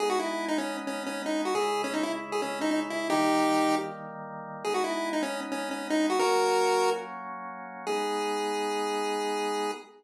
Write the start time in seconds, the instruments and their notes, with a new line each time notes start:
0.00 drawbar organ G#3 B3 D#4, lead 1 (square) G#4
0.10 lead 1 (square) F#4
0.19 lead 1 (square) E4
0.48 lead 1 (square) D#4
0.58 lead 1 (square) C#4
0.87 lead 1 (square) C#4
1.06 lead 1 (square) C#4
1.26 lead 1 (square) D#4
1.45 lead 1 (square) F#4
1.55 drawbar organ C#3 G#3 E4, lead 1 (square) G#4
1.84 lead 1 (square) C#4
1.94 lead 1 (square) D#4
2.03 lead 1 (square) E4
2.32 lead 1 (square) G#4
2.42 lead 1 (square) C#4
2.61 lead 1 (square) D#4
2.71 lead 1 (square) D#4
2.90 lead 1 (square) E4
3.10 drawbar organ D#3 G3 A#3, lead 1 (square) D#4 G4
4.64 drawbar organ G#3 B3 D#4, lead 1 (square) G#4
4.74 lead 1 (square) F#4
4.84 lead 1 (square) E4
5.13 lead 1 (square) D#4
5.23 lead 1 (square) C#4
5.52 lead 1 (square) C#4
5.71 lead 1 (square) C#4
5.90 lead 1 (square) D#4
6.10 lead 1 (square) F#4
6.19 drawbar organ F#3 A#3 C#4, lead 1 (square) F#4 A#4
7.87 drawbar organ G#3 B3 D#4, lead 1 (square) G#4